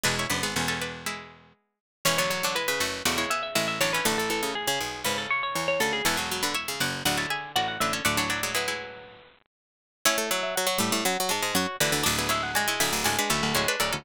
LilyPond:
<<
  \new Staff \with { instrumentName = "Pizzicato Strings" } { \time 4/4 \key fis \minor \tempo 4 = 120 b''8. gis''4.~ gis''16 r4. | \key a \major cis''16 cis''16 cis''8 b'16 b'8. d''16 cis''16 e''16 e''16 e''16 e''16 cis''16 b'16 | a'16 a'16 a'8 gis'16 gis'8. b'16 a'16 cis''16 cis''16 cis''16 cis''16 a'16 gis'16 | <fis'' a''>4 e''8 fis''8 fis''16 a''16 gis''8 fis''16 fis''16 e''16 r16 |
d''16 cis''16 d''8 b'2~ b'8 r8 | \key fis \minor cis''8 e''16 e''16 fis''4 fis''8 a''8 cis''8 d''16 r16 | d''8 e''16 fis''16 gis''4 gis''8 b''8 cis''8 d''16 r16 | }
  \new Staff \with { instrumentName = "Pizzicato Strings" } { \time 4/4 \key fis \minor <d' b'>16 <e' cis''>16 <d' b'>16 <b gis'>16 <cis' a'>16 <cis' a'>16 <d' b'>8 <gis e'>4. r8 | \key a \major <e cis'>16 <d b>8 <fis d'>16 <gis e'>8 <a fis'>8 <a fis'>16 <gis e'>16 <b gis'>8 <gis e'>8 <fis d'>16 <e cis'>16 | <a fis'>2 r2 | <cis' a'>16 <b gis'>8 <d' b'>16 <e' cis''>8 <fis' d''>8 <fis' d''>16 <e' cis''>16 <gis' e''>8 <fis' d''>8 <d' b'>16 <cis' a'>16 |
<a fis'>16 <fis d'>16 <fis d'>16 <gis e'>16 <gis e'>16 <gis e'>4.~ <gis e'>16 r4 | \key fis \minor <e' cis''>1 | <fis' d''>16 <gis' e''>16 <e' cis''>8 <fis' d''>16 <e' cis''>16 <gis' e''>8 <fis' d''>16 <d' b'>16 <cis' a'>8 <e' cis''>16 <d' b'>16 <cis' a'>16 <cis' a'>16 | }
  \new Staff \with { instrumentName = "Pizzicato Strings" } { \time 4/4 \key fis \minor gis8 b2. r8 | \key a \major e16 fis16 fis16 d16 r16 cis16 r8 cis4. d8 | d16 e16 e16 cis16 r16 cis16 r8 cis4. cis8 | e16 fis16 fis16 d16 r16 cis16 r8 d4. d8 |
d16 e8 fis16 fis4. r4. | \key fis \minor cis'16 a16 fis8 fis16 fis16 g8 fis16 fis16 gis8 fis'8 e8 | d'16 b16 gis8 gis16 gis16 a8 gis16 gis16 a8 gis8 fis8 | }
  \new Staff \with { instrumentName = "Pizzicato Strings" } { \time 4/4 \key fis \minor <e,, e,>8 <fis,, fis,>16 <gis,, gis,>16 <e,, e,>2 r4 | \key a \major <e,, e,>4. <fis,, fis,>8 <e,, e,>8 r8 <a,, a,>8 <a,, a,>8 | <a,, a,>4. <b,, b,>8 <gis,, gis,>8 r8 <e, e>8 <d, d>8 | <e,, e,>4. <fis,, fis,>8 <d,, d,>8 r8 <a,, a,>8 <a,, a,>8 |
<d,, d,>2~ <d,, d,>8 r4. | \key fis \minor <a, a>8. r8. <a, a>16 <a, a>16 <fis, fis>16 r16 <gis, gis>16 <gis, gis>16 <fis, fis>16 r16 <d, d>16 <d, d>16 | <d,, d,>4. <d,, d,>16 <d,, d,>16 <d,, d,>16 r16 <d,, d,>16 <d,, d,>16 <d,, d,>16 r16 <d,, d,>16 <d,, d,>16 | }
>>